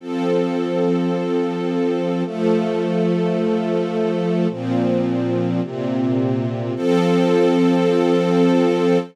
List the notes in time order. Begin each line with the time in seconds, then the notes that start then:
0.00 F3 C4 A4
2.25 F3 A3 A4
4.50 A#2 F3 C4
5.62 A#2 C3 C4
6.76 F3 C4 A4